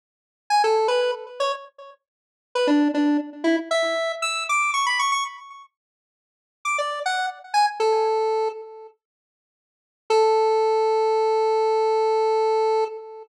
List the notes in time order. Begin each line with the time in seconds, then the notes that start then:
0.50 G#5
0.64 A4
0.88 B4
1.40 C#5
2.55 B4
2.67 D4
2.94 D4
3.44 E4
3.71 E5
4.22 E6
4.49 D6
4.74 C#6
4.86 B5
4.99 C#6
5.12 C#6
6.65 D6
6.78 D5
7.06 F#5
7.54 G#5
7.80 A4
10.10 A4